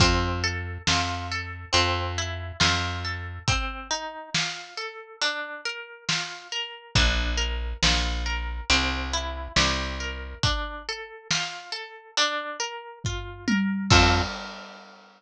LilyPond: <<
  \new Staff \with { instrumentName = "Orchestral Harp" } { \time 4/4 \key f \major \tempo 4 = 69 c'8 a'8 f'8 a'8 c'8 e'8 f'8 a'8 | c'8 ees'8 f'8 a'8 d'8 bes'8 f'8 bes'8 | d'8 bes'8 f'8 bes'8 c'8 e'8 g'8 bes'8 | d'8 a'8 f'8 a'8 d'8 bes'8 f'8 bes'8 |
<c' f' a'>4 r2. | }
  \new Staff \with { instrumentName = "Electric Bass (finger)" } { \clef bass \time 4/4 \key f \major f,4 f,4 f,4 f,4 | r1 | bes,,4 bes,,4 c,4 c,4 | r1 |
f,4 r2. | }
  \new DrumStaff \with { instrumentName = "Drums" } \drummode { \time 4/4 <hh bd>4 sn4 hh4 sn4 | <hh bd>4 sn4 hh4 sn4 | <hh bd>4 sn4 hh4 sn4 | <hh bd>4 sn4 hh4 <bd tomfh>8 tommh8 |
<cymc bd>4 r4 r4 r4 | }
>>